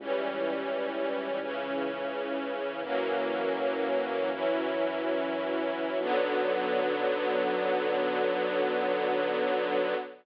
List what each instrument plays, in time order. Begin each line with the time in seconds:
0.00 synth bass 1 C#2, string ensemble 1 E3 G3 C#4
1.41 string ensemble 1 C#3 E3 C#4
2.83 synth bass 1 F#2, string ensemble 1 E3 F#3 A#3 C#4
4.32 string ensemble 1 E3 F#3 C#4 E4
6.00 synth bass 1 B1, string ensemble 1 D3 F#3 B3